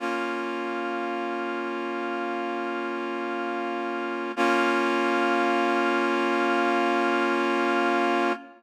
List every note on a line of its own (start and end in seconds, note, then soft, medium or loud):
0.00 4.32 A#3 medium
0.00 4.32 C#4 medium
0.00 4.32 F4 medium
4.36 8.32 A#3 loud
4.36 8.32 C#4 loud
4.36 8.32 F4 loud